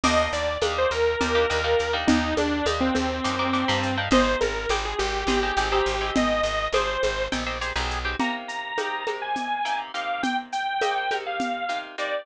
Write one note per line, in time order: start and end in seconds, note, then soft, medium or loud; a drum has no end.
0.04 0.28 D#2 loud
0.04 0.51 A#3 loud
0.04 0.51 D4 loud
0.04 0.51 D#4 loud
0.04 0.51 G4 loud
0.04 0.29 D#5 loud
0.04 crash loud
0.04 low conga loud
0.04 shaker medium
0.33 0.57 D#2 loud
0.33 0.57 D5 medium
0.33 shaker medium
0.62 0.86 D#2 loud
0.62 1.09 A#3 loud
0.62 1.09 D4 medium
0.62 1.09 D#4 loud
0.62 1.09 G4 medium
0.62 high conga medium
0.62 shaker medium
0.78 0.92 C5 loud
0.91 1.16 D#2 medium
0.91 1.95 A#4 loud
0.91 shaker medium
1.21 1.46 D#2 loud
1.21 1.32 A#3 medium
1.21 1.32 D4 medium
1.21 1.32 D#4 medium
1.21 1.32 G4 medium
1.21 low conga medium
1.21 shaker medium
1.35 1.47 A#3 loud
1.35 1.47 D4 loud
1.35 1.47 D#4 loud
1.35 1.47 G4 medium
1.50 1.75 D#2 loud
1.50 1.61 A#3 medium
1.50 1.61 D4 medium
1.50 1.61 D#4 medium
1.50 1.61 G4 medium
1.50 shaker medium
1.64 1.87 A#3 medium
1.64 1.87 D4 medium
1.64 1.87 D#4 medium
1.64 1.87 G4 medium
1.79 2.05 D#2 medium
1.79 shaker medium
1.93 2.40 A#3 loud
1.93 2.40 D4 medium
1.93 2.40 D#4 loud
1.93 2.40 G4 medium
2.07 2.34 D#2 loud
2.07 2.35 D#4 loud
2.07 low conga loud
2.07 shaker medium
2.37 2.62 D#2 medium
2.37 2.66 D4 loud
2.37 high conga medium
2.37 shaker medium
2.66 2.91 D#2 loud
2.66 3.13 A#3 medium
2.66 3.13 D4 medium
2.66 3.13 D#4 loud
2.66 3.13 G4 medium
2.66 high conga medium
2.66 shaker medium
2.80 2.94 C4 loud
2.95 3.21 D#2 loud
2.95 3.97 C4 medium
2.95 high conga medium
2.95 shaker medium
3.24 3.65 F#2 loud
3.24 3.36 A#3 medium
3.24 3.36 D4 medium
3.24 3.36 D#4 loud
3.24 3.36 G4 medium
3.24 shaker medium
3.39 3.51 A#3 medium
3.39 3.51 D4 medium
3.39 3.51 D#4 medium
3.39 3.51 G4 loud
3.53 3.65 A#3 loud
3.53 3.65 D4 loud
3.53 3.65 D#4 medium
3.53 3.65 G4 medium
3.53 shaker medium
3.68 4.08 G2 loud
3.68 3.91 A#3 loud
3.68 3.91 D4 medium
3.68 3.91 D#4 medium
3.68 3.91 G4 loud
3.83 shaker medium
3.97 4.09 A#3 medium
3.97 4.09 D4 loud
3.97 4.09 D#4 medium
3.97 4.09 G4 medium
4.11 4.36 G#1 loud
4.11 4.58 C4 medium
4.11 4.58 D#4 loud
4.11 4.58 G4 loud
4.11 4.58 G#4 loud
4.11 4.37 C5 loud
4.11 low conga loud
4.11 shaker medium
4.41 4.66 G#1 loud
4.41 4.68 A#4 medium
4.41 high conga medium
4.41 shaker medium
4.69 4.94 G#1 loud
4.69 5.17 C4 medium
4.69 5.17 D#4 loud
4.69 5.17 G4 medium
4.69 5.17 G#4 medium
4.69 high conga medium
4.69 shaker medium
4.85 4.99 G#4 medium
4.99 5.24 G#1 loud
4.99 6.10 G4 medium
4.99 shaker medium
5.27 5.52 G#1 loud
5.27 5.40 C4 medium
5.27 5.40 D#4 loud
5.27 5.40 G4 loud
5.27 5.40 G#4 loud
5.27 low conga medium
5.27 shaker medium
5.43 5.54 C4 medium
5.43 5.54 D#4 medium
5.43 5.54 G4 medium
5.43 5.54 G#4 medium
5.57 5.81 G#1 loud
5.57 5.69 C4 medium
5.57 5.69 D#4 medium
5.57 5.69 G4 loud
5.57 5.69 G#4 medium
5.57 shaker medium
5.72 5.95 C4 loud
5.72 5.95 D#4 loud
5.72 5.95 G4 loud
5.72 5.95 G#4 loud
5.86 6.11 G#1 loud
5.86 shaker medium
6.01 6.48 C4 loud
6.01 6.48 D#4 medium
6.01 6.48 G4 medium
6.01 6.48 G#4 medium
6.15 6.41 G#1 medium
6.15 6.68 D#5 loud
6.15 low conga loud
6.15 shaker medium
6.43 6.68 G#1 medium
6.43 shaker medium
6.73 6.97 G#1 loud
6.73 7.21 C4 loud
6.73 7.21 D#4 medium
6.73 7.21 G4 loud
6.73 7.21 G#4 loud
6.73 7.25 C5 medium
6.73 high conga medium
6.73 shaker medium
7.03 7.28 G#1 loud
7.03 high conga medium
7.03 shaker medium
7.32 7.72 A#1 loud
7.32 7.44 C4 loud
7.32 7.44 D#4 medium
7.32 7.44 G4 medium
7.32 7.44 G#4 loud
7.32 low conga medium
7.32 shaker medium
7.47 7.58 C4 medium
7.47 7.58 D#4 medium
7.47 7.58 G4 medium
7.47 7.58 G#4 medium
7.61 7.73 C4 medium
7.61 7.73 D#4 loud
7.61 7.73 G4 loud
7.61 7.73 G#4 loud
7.61 shaker medium
7.76 8.15 B1 loud
7.76 7.99 C4 medium
7.76 7.99 D#4 loud
7.76 7.99 G4 medium
7.76 7.99 G#4 loud
7.90 shaker medium
8.05 8.16 C4 medium
8.05 8.16 D#4 medium
8.05 8.16 G4 loud
8.05 8.16 G#4 medium
8.19 8.73 C3 medium
8.19 8.73 A#3 medium
8.19 8.73 D#4 medium
8.19 8.73 G4 medium
8.19 8.34 A#5 loud
8.19 low conga medium
8.19 shaker medium
8.48 9.10 A#5 medium
8.48 shaker medium
8.78 9.05 C3 medium
8.78 9.05 A#3 medium
8.78 9.05 D#4 medium
8.78 9.05 G4 medium
8.78 high conga medium
8.78 shaker medium
9.07 9.61 C3 medium
9.07 9.61 A#3 medium
9.07 9.61 D#4 medium
9.07 9.61 G4 medium
9.07 high conga medium
9.07 shaker medium
9.22 9.79 G#5 medium
9.36 low conga medium
9.36 shaker medium
9.65 9.92 C3 medium
9.65 9.92 A#3 medium
9.65 9.92 D#4 medium
9.65 9.92 G4 medium
9.65 shaker medium
9.94 10.75 C3 medium
9.94 10.75 A#3 medium
9.94 10.75 D#4 medium
9.94 10.75 G4 medium
9.94 10.22 F5 medium
9.94 shaker medium
10.23 10.37 G5 medium
10.23 low conga medium
10.23 shaker medium
10.52 11.15 G5 medium
10.52 shaker medium
10.81 11.08 C3 medium
10.81 11.08 A#3 medium
10.81 11.08 D#4 medium
10.81 11.08 G4 medium
10.81 high conga medium
10.81 shaker medium
11.11 11.65 C3 medium
11.11 11.65 A#3 medium
11.11 11.65 D#4 medium
11.11 11.65 G4 medium
11.11 high conga medium
11.11 shaker medium
11.26 11.78 F5 medium
11.40 low conga medium
11.40 shaker medium
11.69 11.96 C3 medium
11.69 11.96 A#3 medium
11.69 11.96 D#4 medium
11.69 11.96 G4 medium
11.69 shaker medium
11.98 12.25 C3 medium
11.98 12.25 A#3 medium
11.98 12.25 D#4 medium
11.98 12.25 G4 medium
11.98 12.26 D5 medium
11.98 shaker medium